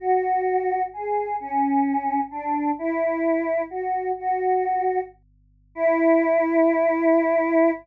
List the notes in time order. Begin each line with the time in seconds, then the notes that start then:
0.00 F#4
0.93 G#4
1.40 C#4
2.31 D4
2.79 E4
3.70 F#4
4.19 F#4
5.75 E4